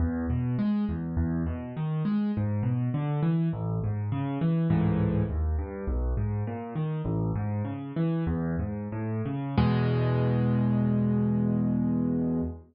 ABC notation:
X:1
M:4/4
L:1/8
Q:1/4=102
K:E
V:1 name="Acoustic Grand Piano" clef=bass
E,, B,, G, E,, E,, B,, D, G, | G,, B,, =D, E, A,,, G,, C, E, | [C,,G,,A,,E,]2 D,, =G,, B,,, ^G,, ^A,, D, | "^rit." A,,, G,, C, E, E,, G,, A,, C, |
[E,,B,,G,]8 |]